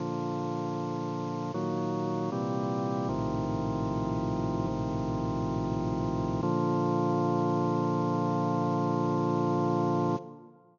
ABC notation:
X:1
M:4/4
L:1/8
Q:1/4=78
K:Bb
V:1 name="Drawbar Organ" clef=bass
[B,,D,F,]4 [B,,E,_G,]2 [B,,C,=E,=G,]2 | "^rit." [B,,,A,,C,E,F,]4 [B,,,A,,C,E,F,]4 | [B,,D,F,]8 |]